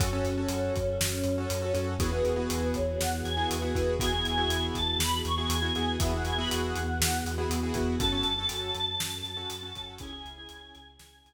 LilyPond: <<
  \new Staff \with { instrumentName = "Choir Aahs" } { \time 4/4 \key cis \minor \tempo 4 = 120 cis'1 | b'4. cis''8 fis''8 gis''8 b'4 | gis''4. a''8 b''8 cis'''8 gis''4 | e''16 fis''16 gis''16 b''16 fis''2 r4 |
a''1 | gis''2 gis''4 r4 | }
  \new Staff \with { instrumentName = "Acoustic Grand Piano" } { \time 4/4 \key cis \minor <cis' fis' a'>16 <cis' fis' a'>8 <cis' fis' a'>2 <cis' fis' a'>8 <cis' fis' a'>16 <cis' fis' a'>8 | <b e' fis' gis'>16 <b e' fis' gis'>8 <b e' fis' gis'>2 <b e' fis' gis'>8 <b e' fis' gis'>16 <b e' fis' gis'>8 | <b e' fis' gis'>16 <b e' fis' gis'>8 <b e' fis' gis'>2 <b e' fis' gis'>8 <b e' fis' gis'>16 <b e' fis' gis'>8 | <b e' fis' gis'>16 <b e' fis' gis'>8 <b e' fis' gis'>2 <b e' fis' gis'>8 <b e' fis' gis'>16 <b e' fis' gis'>8 |
<cis' fis' a'>16 <cis' fis' a'>8 <cis' fis' a'>2 <cis' fis' a'>8 <cis' fis' a'>16 <cis' fis' a'>8 | <cis' e' gis'>16 <cis' e' gis'>8 <cis' e' gis'>2 r4 r16 | }
  \new Staff \with { instrumentName = "Synth Bass 2" } { \clef bass \time 4/4 \key cis \minor fis,8 fis,8 fis,8 fis,8 fis,8 fis,8 fis,8 fis,8 | e,8 e,8 e,8 e,8 e,8 e,8 e,8 e,8 | e,8 e,8 e,8 e,8 e,8 e,8 e,8 e,8 | e,8 e,8 e,8 e,8 e,8 e,8 e,8 e,8 |
fis,8 fis,8 fis,8 fis,8 fis,8 fis,8 fis,8 fis,8 | cis,8 cis,8 cis,8 cis,8 cis,8 cis,8 r4 | }
  \new Staff \with { instrumentName = "String Ensemble 1" } { \time 4/4 \key cis \minor <cis' fis' a'>1 | <b e' fis' gis'>1 | <b e' fis' gis'>1 | <b e' fis' gis'>1 |
<cis' fis' a'>1 | <cis' e' gis'>1 | }
  \new DrumStaff \with { instrumentName = "Drums" } \drummode { \time 4/4 <hh bd>8 hh8 hh8 <hh bd>8 sn8 hh8 hh8 hh8 | <hh bd>8 hh8 hh8 <hh bd>8 sn8 hh8 hh8 <hh bd>8 | <hh bd>8 hh8 hh8 <hh bd>8 sn8 hh8 hh8 hh8 | <hh bd>8 hh8 hh8 hh8 sn8 hh8 hh8 <hh bd>8 |
<hh bd>8 hh8 hh8 hh8 sn8 hh8 hh8 <hh bd>8 | <hh bd>8 hh8 hh8 hh8 sn8 hh8 r4 | }
>>